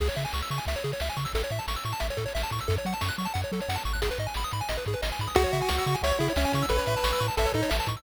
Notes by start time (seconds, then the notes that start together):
0.00 C#2 G#4, kick, crash
0.09 C#5, closed hi-hat
0.16 C#3 E5, closed hi-hat
0.25 G#5, closed hi-hat
0.33 C#2 C#6, snare
0.41 E6, closed hi-hat
0.50 C#3 C#6, closed hi-hat
0.58 G#5, closed hi-hat
0.65 C#2 E5, kick, closed hi-hat
0.76 C#5, closed hi-hat
0.84 C#3 G#4, closed hi-hat
0.92 C#5, closed hi-hat
1.00 C#2 E5, snare
1.09 G#5, closed hi-hat
1.16 C#3 C#6, kick, closed hi-hat
1.25 E6, kick, closed hi-hat
1.33 A1 A4, kick, closed hi-hat
1.43 C#5, closed hi-hat
1.50 A2 E5, closed hi-hat
1.59 A5, closed hi-hat
1.68 A1 C#6, snare
1.76 E6, closed hi-hat
1.84 A2 C#6, closed hi-hat
1.92 A5, closed hi-hat
2.00 A1 E5, kick, closed hi-hat
2.10 C#5, closed hi-hat
2.17 A2 A4, kick, closed hi-hat
2.26 C#5, closed hi-hat
2.35 A1 E5, snare
2.43 A5, closed hi-hat
2.50 A2 C#6, kick, closed hi-hat
2.59 E6, kick, closed hi-hat
2.68 F#2 A4, kick, closed hi-hat
2.76 C#5, closed hi-hat
2.85 F#3 F#5, closed hi-hat
2.93 A5, closed hi-hat
3.01 F#2 C#6, snare
3.09 F#6, closed hi-hat
3.18 F#3 C#6, closed hi-hat
3.25 A5, closed hi-hat
3.34 F#2 F#5, kick, closed hi-hat
3.42 C#5, closed hi-hat
3.52 F#3 A4, closed hi-hat
3.60 C#5, closed hi-hat
3.69 F#2 F#5, snare
3.76 A5, closed hi-hat
3.84 G#1 C#6, kick, closed hi-hat
3.93 F#6, kick, closed hi-hat
4.02 G#4, kick, closed hi-hat
4.11 B4, closed hi-hat
4.18 G#2 D#5, closed hi-hat
4.27 G#5, closed hi-hat
4.34 G#1 B5, snare
4.43 D#6, closed hi-hat
4.51 G#2 B5, closed hi-hat
4.61 G#5, closed hi-hat
4.69 G#1 D#5, kick, closed hi-hat
4.77 B4, closed hi-hat
4.85 G#2 G#4, kick, closed hi-hat
4.93 B4, closed hi-hat
5.02 G#1 D#5, snare
5.12 G#5, closed hi-hat
5.19 G#2 B5, kick, closed hi-hat
5.27 D#6, kick, closed hi-hat
5.35 C#2 F#4 G#4, kick, closed hi-hat
5.44 C#5, closed hi-hat
5.53 C#3 E5, closed hi-hat
5.61 G#5, closed hi-hat
5.69 C#2 C#6, snare
5.77 E6, closed hi-hat
5.86 C#3 C#6, closed hi-hat
5.95 G#5, closed hi-hat
6.01 C#2 C#5 E5, kick, closed hi-hat
6.10 C#5, closed hi-hat
6.19 C#3 E4 G#4, closed hi-hat
6.28 C#5, closed hi-hat
6.36 C#2 C#4 E5, snare
6.44 G#5, closed hi-hat
6.52 C#3 C#6, kick, closed hi-hat
6.62 E6, kick, closed hi-hat
6.69 A1 A4 B4, kick, closed hi-hat
6.77 C#5, closed hi-hat
6.86 A2 E5, closed hi-hat
6.97 A5, closed hi-hat
7.04 A1 C#6, snare
7.11 E6, closed hi-hat
7.20 A2 C#6, closed hi-hat
7.28 A5, closed hi-hat
7.37 A1 A4 E5, kick, closed hi-hat
7.45 C#5, closed hi-hat
7.52 A2 D#4 A4, kick, closed hi-hat
7.63 C#5, closed hi-hat
7.70 A1 E5, snare
7.78 A5, closed hi-hat
7.87 A2 C#6, kick, closed hi-hat
7.96 E6, kick, closed hi-hat